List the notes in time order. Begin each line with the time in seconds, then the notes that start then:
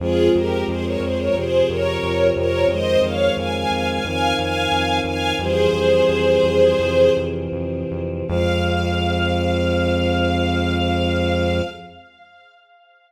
0.00 F2 F3 G#3 C4 F4 G#4
0.34 F2 G4 A#4
0.67 F2 G#4 C5
0.84 A#4 C#5
1.00 F2 G#4 C5
1.18 A#4 C#5
1.34 F2 C3 F3 C4 G#4 C5
1.69 F2 A#4 C#5
2.03 F2
2.36 F2 A#4 C#5
2.68 F2 D#3 G#3 C4 C5 D#5
3.01 F2 C#5 F5
3.37 F2 F5 G#5
3.54 F5 G#5
3.71 F2 F5 G#5
3.88 F5 G#5
4.04 F2 D#3 C4 D#4 F5 G#5
4.38 F2 F5 G#5
4.72 F2
5.04 F2 F5 G#5
5.39 F2 E3 G3 C4 G#4 C5
5.73 F2
6.09 F2
6.44 F2
6.79 F2 C3 E3 C4
7.17 F2
7.52 F2
7.91 F2
8.28 F2 F3 G#3 C4 F5